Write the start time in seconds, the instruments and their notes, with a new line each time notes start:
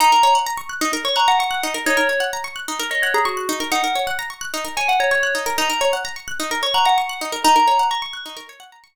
0.00 pizzicato strings D#4, tubular bells A#5
0.12 pizzicato strings A#4
0.23 pizzicato strings C#5
0.35 pizzicato strings F#5
0.47 pizzicato strings A#5
0.57 pizzicato strings C#6
0.69 pizzicato strings F#6
0.81 pizzicato strings D#4
0.93 pizzicato strings A#4
1.05 pizzicato strings C#5, tubular bells C#6
1.16 pizzicato strings F#5, tubular bells A#5
1.28 tubular bells F#5, pizzicato strings A#5
1.39 tubular bells F#5, pizzicato strings C#6
1.51 pizzicato strings F#6
1.63 pizzicato strings D#4
1.74 pizzicato strings A#4
1.86 pizzicato strings D#4, tubular bells C#5
1.97 pizzicato strings A#4
2.09 pizzicato strings C#5
2.20 pizzicato strings F#5
2.33 pizzicato strings A#5
2.44 pizzicato strings C#6
2.56 pizzicato strings F#6
2.68 pizzicato strings D#4
2.79 pizzicato strings A#4
2.91 pizzicato strings C#5, tubular bells D#5
3.02 tubular bells C#5, pizzicato strings F#5
3.14 tubular bells G#4, pizzicato strings A#5
3.25 tubular bells F#4, pizzicato strings C#6
3.37 pizzicato strings F#6
3.49 pizzicato strings D#4
3.60 pizzicato strings A#4
3.72 pizzicato strings D#4, tubular bells F#5
3.84 pizzicato strings A#4
3.95 pizzicato strings C#5
4.07 pizzicato strings F#5
4.19 pizzicato strings A#5
4.30 pizzicato strings C#6
4.41 pizzicato strings F#6
4.54 pizzicato strings D#4
4.65 pizzicato strings A#4
4.77 pizzicato strings C#5, tubular bells G#5
4.88 tubular bells F#5, pizzicato strings F#5
5.00 tubular bells C#5, pizzicato strings A#5
5.11 tubular bells C#5, pizzicato strings C#6
5.23 pizzicato strings F#6
5.35 pizzicato strings D#4
5.46 pizzicato strings A#4
5.58 pizzicato strings D#4, tubular bells A#5
5.70 pizzicato strings A#4
5.81 pizzicato strings C#5
5.93 pizzicato strings F#5
6.05 pizzicato strings A#5
6.16 pizzicato strings C#6
6.28 pizzicato strings F#6
6.40 pizzicato strings D#4
6.51 pizzicato strings A#4
6.63 pizzicato strings C#5, tubular bells C#6
6.74 pizzicato strings F#5, tubular bells A#5
6.85 tubular bells F#5, pizzicato strings A#5
6.98 tubular bells F#5, pizzicato strings C#6
7.09 pizzicato strings F#6
7.21 pizzicato strings D#4
7.32 pizzicato strings A#4
7.44 pizzicato strings D#4, tubular bells A#5
7.56 pizzicato strings A#4
7.68 pizzicato strings C#5
7.79 pizzicato strings F#5
7.91 pizzicato strings A#5, tubular bells C#6
8.02 pizzicato strings C#6
8.13 pizzicato strings F#6
8.26 pizzicato strings D#4
8.37 pizzicato strings A#4
8.49 pizzicato strings C#5
8.60 pizzicato strings F#5
8.72 pizzicato strings A#5
8.84 pizzicato strings C#6